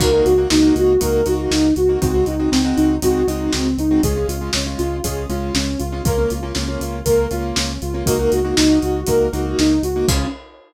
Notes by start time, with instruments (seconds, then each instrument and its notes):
0.00 synth bass 1 C#2, acoustic grand piano A#3 D#4 F#4, ocarina A#4, kick, crash
0.13 acoustic grand piano A#3 D#4 F#4
0.25 synth bass 1 C#2, ocarina F#4, closed hi-hat
0.38 acoustic grand piano A#3 D#4 F#4
0.50 synth bass 1 C#2, acoustic grand piano A#3 D#4 F#4, ocarina D#4, snare
0.63 acoustic grand piano A#3 D#4 F#4
0.76 synth bass 1 C#2, ocarina F#4, closed hi-hat
1.01 synth bass 1 C#2, acoustic grand piano A#3 D#4 F#4, ocarina A#4, kick, closed hi-hat
1.26 synth bass 1 C#2, acoustic grand piano A#3 D#4 F#4, ocarina F#4, closed hi-hat
1.51 synth bass 1 C#2, ocarina D#4, snare
1.76 synth bass 1 C#2, ocarina F#4, closed hi-hat
1.89 acoustic grand piano A#3 D#4 F#4
2.02 synth bass 1 C#2, acoustic grand piano G#3 C4 D#4 F#4, ocarina F#4, kick, closed hi-hat
2.14 acoustic grand piano G#3 C4 D#4 F#4
2.26 synth bass 1 C#2, ocarina D#4, closed hi-hat
2.39 acoustic grand piano G#3 C4 D#4 F#4
2.51 synth bass 1 C#2, acoustic grand piano G#3 C4 D#4 F#4, ocarina C4, snare
2.65 acoustic grand piano G#3 C4 D#4 F#4
2.76 synth bass 1 C#2, ocarina D#4, closed hi-hat
3.02 synth bass 1 C#2, acoustic grand piano G#3 C4 D#4 F#4, ocarina F#4, kick, closed hi-hat
3.27 synth bass 1 C#2, acoustic grand piano G#3 C4 D#4 F#4, ocarina D#4, closed hi-hat
3.53 synth bass 1 C#2, ocarina C4, snare
3.78 synth bass 1 C#2, ocarina D#4, closed hi-hat
3.91 acoustic grand piano G#3 C4 D#4 F#4
4.03 synth bass 1 C#2, acoustic grand piano G#3 C#4 F4, ocarina G#4, kick, closed hi-hat
4.16 acoustic grand piano G#3 C#4 F4
4.28 synth bass 1 C#2, ocarina F4, closed hi-hat
4.41 acoustic grand piano G#3 C#4 F4
4.53 synth bass 1 C#2, acoustic grand piano G#3 C#4 F4, ocarina C#4, snare
4.66 acoustic grand piano G#3 C#4 F4
4.78 synth bass 1 C#2, ocarina F4, closed hi-hat
5.04 synth bass 1 C#2, acoustic grand piano G#3 C#4 F4, ocarina G#4, kick, closed hi-hat
5.29 synth bass 1 C#2, acoustic grand piano G#3 C#4 F4, ocarina F4, closed hi-hat
5.54 synth bass 1 C#2, ocarina C#4, snare
5.79 synth bass 1 C#2, ocarina F4, closed hi-hat
5.92 acoustic grand piano G#3 C#4 F4
6.05 synth bass 1 C#2, acoustic grand piano A#3 C#4 F4, ocarina A#4, kick, closed hi-hat
6.18 acoustic grand piano A#3 C#4 F4
6.30 synth bass 1 C#2, ocarina F4, closed hi-hat
6.43 acoustic grand piano A#3 C#4 F4
6.55 synth bass 1 C#2, acoustic grand piano A#3 C#4 F4, ocarina C#4, snare
6.68 acoustic grand piano A#3 C#4 F4
6.80 synth bass 1 C#2, ocarina F4, closed hi-hat
7.05 synth bass 1 C#2, acoustic grand piano A#3 C#4 F4, ocarina A#4, kick, closed hi-hat
7.31 synth bass 1 C#2, acoustic grand piano A#3 C#4 F4, ocarina F4, closed hi-hat
7.55 synth bass 1 C#2, ocarina C#4, snare
7.81 synth bass 1 C#2, ocarina F4, closed hi-hat
7.94 acoustic grand piano A#3 C#4 F4
8.06 synth bass 1 C#2, acoustic grand piano A#3 D#4 F#4, ocarina A#4, kick, closed hi-hat
8.19 acoustic grand piano A#3 D#4 F#4
8.32 synth bass 1 C#2, ocarina F#4, closed hi-hat
8.45 acoustic grand piano A#3 D#4 F#4
8.56 synth bass 1 C#2, acoustic grand piano A#3 D#4 F#4, ocarina D#4, snare
8.70 acoustic grand piano A#3 D#4 F#4
8.82 synth bass 1 C#2, ocarina F#4, closed hi-hat
9.07 synth bass 1 C#2, acoustic grand piano A#3 D#4 F#4, ocarina A#4, kick, closed hi-hat
9.33 synth bass 1 C#2, acoustic grand piano A#3 D#4 F#4, ocarina F#4, closed hi-hat
9.59 synth bass 1 C#2, ocarina D#4, snare
9.83 synth bass 1 C#2, ocarina F#4, closed hi-hat
9.96 acoustic grand piano A#3 D#4 F#4
10.08 synth bass 1 C#2, ocarina C#4, acoustic grand piano C#4 F4 G#4, kick, crash